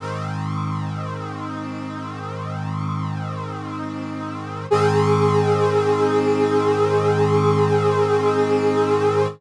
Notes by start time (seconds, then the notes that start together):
0.00 G#2 D#3 C4
4.71 G#2 D#3 C4 G#4